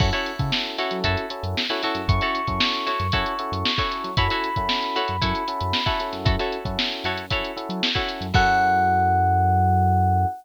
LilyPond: <<
  \new Staff \with { instrumentName = "Electric Piano 1" } { \time 4/4 \key fis \dorian \tempo 4 = 115 r1 | cis'''1 | b''1 | r1 |
fis''1 | }
  \new Staff \with { instrumentName = "Pizzicato Strings" } { \time 4/4 \key fis \dorian <e' fis' a' cis''>16 <e' fis' a' cis''>4~ <e' fis' a' cis''>16 <e' fis' a' cis''>8 <e' fis' a' cis''>4~ <e' fis' a' cis''>16 <e' fis' a' cis''>16 <e' fis' a' cis''>8~ | <e' fis' a' cis''>16 <e' fis' a' cis''>4~ <e' fis' a' cis''>16 <e' fis' a' cis''>8 <e' fis' a' cis''>4~ <e' fis' a' cis''>16 <e' fis' a' cis''>8. | <e' fis' a' cis''>16 <e' fis' a' cis''>4~ <e' fis' a' cis''>16 <e' fis' a' cis''>8 <e' fis' a' cis''>4~ <e' fis' a' cis''>16 <e' fis' a' cis''>8. | <e' fis' a' cis''>16 <e' fis' a' cis''>4~ <e' fis' a' cis''>16 <e' fis' a' cis''>8 <e' fis' a' cis''>4~ <e' fis' a' cis''>16 <e' fis' a' cis''>8. |
<e' fis' a' cis''>1 | }
  \new Staff \with { instrumentName = "Electric Piano 1" } { \time 4/4 \key fis \dorian <cis' e' fis' a'>8. <cis' e' fis' a'>8. <cis' e' fis' a'>4 <cis' e' fis' a'>8. <cis' e' fis' a'>8. | <cis' e' fis' a'>8. <cis' e' fis' a'>4~ <cis' e' fis' a'>16 <cis' e' fis' a'>8 <cis' e' fis' a'>8. <cis' e' fis' a'>8. | <cis' e' fis' a'>8. <cis' e' fis' a'>4~ <cis' e' fis' a'>16 <cis' e' fis' a'>8 <cis' e' fis' a'>8. <cis' e' fis' a'>16 <cis' e' fis' a'>8~ | <cis' e' fis' a'>8. <cis' e' fis' a'>4~ <cis' e' fis' a'>16 <cis' e' fis' a'>8 <cis' e' fis' a'>8. <cis' e' fis' a'>8. |
<cis' e' fis' a'>1 | }
  \new Staff \with { instrumentName = "Synth Bass 1" } { \clef bass \time 4/4 \key fis \dorian fis,8. cis4 fis16 fis,8. fis,4 fis,16 | fis,8. fis,4 fis,16 fis,8. fis,4 fis16 | fis,8. fis,4 fis,16 fis,8. fis,4 fis,16 | fis,8. fis,8. fis,4~ fis,16 fis4 fis,16 |
fis,1 | }
  \new DrumStaff \with { instrumentName = "Drums" } \drummode { \time 4/4 <cymc bd>16 hh16 hh16 <hh bd>16 sn16 hh16 <hh sn>16 hh16 <hh bd>16 hh16 hh16 hh16 sn16 hh16 <hh sn>16 hh16 | <hh bd>16 hh16 hh16 <hh bd>16 sn16 hh16 <hh sn>16 hh16 <hh bd>16 hh16 hh16 hh16 sn16 <hh bd>16 hh16 hh16 | <hh bd>16 hh16 hh16 <hh bd>16 sn16 hh16 hh16 hh16 <hh bd>16 hh16 hh16 hh16 sn16 <hh bd>16 hh16 <hh sn>16 | <hh bd>16 hh16 hh16 <hh bd>16 sn16 <hh sn>16 hh16 hh16 <hh bd>16 hh16 hh16 hh16 sn16 <hh bd>16 hh16 hh16 |
<cymc bd>4 r4 r4 r4 | }
>>